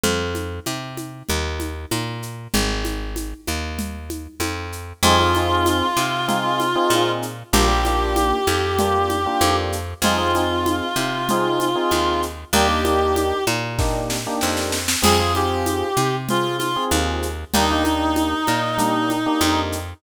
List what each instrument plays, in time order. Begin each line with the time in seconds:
0.04 electric bass (finger) F2, low conga, shaker
0.35 high conga, shaker
0.66 electric bass (finger) C3, high conga, shaker
0.97 high conga, shaker
1.29 electric bass (finger) D#2, low conga
1.60 high conga, shaker
1.91 electric bass (finger) A#2, high conga, shaker
2.23 shaker
2.54 electric bass (finger) G#1, low conga, shaker
2.85 high conga, shaker
3.16 high conga, shaker
3.47 electric bass (finger) D#2, high conga, shaker
3.79 low conga, shaker
4.10 high conga, shaker
4.40 electric bass (finger) F2, high conga, shaker
4.72 shaker
5.03 electric bass (finger) F2, electric piano 1 C4 D#4 F4 G#4, clarinet F4, low conga, shaker
5.19 electric piano 1 C4 D#4 F4 G#4
5.35 electric piano 1 C4 D#4 F4 G#4, high conga, shaker
5.66 high conga, shaker
5.97 electric bass (finger) C3, high conga, shaker
6.28 electric piano 1 C4 D#4 F4 G#4, low conga, shaker
6.60 high conga, shaker
6.75 electric piano 1 C4 D#4 F4 G#4
6.90 electric bass (finger) A#2, high conga, shaker
7.22 shaker
7.53 electric bass (finger) A#1, electric piano 1 A#3 D4 F4 G4, clarinet G4, low conga, shaker
7.68 electric piano 1 A#3 D4 F4 G4
7.85 electric piano 1 A#3 D4 F4 G4, high conga, shaker
8.16 high conga, shaker
8.47 electric bass (finger) F2, high conga, shaker
8.79 electric piano 1 A#3 D4 F4 G4, low conga, shaker
9.10 high conga, shaker
9.26 electric piano 1 A#3 D4 F4 G4
9.41 electric bass (finger) F2, high conga, shaker
9.72 shaker
10.02 electric bass (finger) F2, electric piano 1 C4 D#4 F4 G#4, clarinet F4, low conga, shaker
10.18 electric piano 1 C4 D#4 F4 G#4
10.35 electric piano 1 C4 D#4 F4 G#4, high conga, shaker
10.66 high conga, shaker
10.96 electric bass (finger) C3, high conga, shaker
11.29 electric piano 1 C4 D#4 F4 G#4, low conga, shaker
11.60 high conga, shaker
11.75 electric piano 1 C4 D#4 F4 G#4
11.91 electric bass (finger) D#2, high conga, shaker
12.22 shaker
12.53 electric bass (finger) D#2, electric piano 1 A#3 D4 D#4 G4, clarinet G4, low conga, shaker
12.68 electric piano 1 A#3 D4 D#4 G4
12.84 electric piano 1 A#3 D4 D#4 G4, high conga, shaker
13.16 high conga, shaker
13.47 electric bass (finger) A#2, high conga, shaker
13.79 electric piano 1 A#3 D4 D#4 G4, kick, snare
14.10 snare
14.27 electric piano 1 A#3 D4 D#4 G4
14.41 electric bass (finger) F2, snare
14.57 snare
14.72 snare
14.88 snare
15.02 electric bass (finger) F2, electric piano 1 C4 F4 G#4, clarinet G#4, crash, low conga, shaker
15.20 electric piano 1 C4 F4 G#4
15.35 electric piano 1 C4 F4 G#4, clarinet G4, high conga, shaker
15.66 high conga, shaker
15.97 electric bass (finger) C3, high conga, shaker
16.29 electric piano 1 C4 F4 G#4, clarinet F4, low conga, shaker
16.58 clarinet F4, high conga, shaker
16.76 electric piano 1 C4 F4 G#4
16.91 electric bass (finger) D#2, high conga, shaker
17.22 shaker
17.54 electric bass (finger) D#2, electric piano 1 A#3 D4 D#4 G4, clarinet D#4, low conga, shaker
17.71 electric piano 1 A#3 D4 D#4 G4
17.84 electric piano 1 A#3 D4 D#4 G4, high conga, shaker
18.16 high conga, shaker
18.47 electric bass (finger) A#2, high conga, shaker
18.78 electric piano 1 A#3 D4 D#4 G4, low conga, shaker
19.10 high conga, shaker
19.26 electric piano 1 A#3 D4 D#4 G4
19.41 electric bass (finger) F2, high conga, shaker
19.72 shaker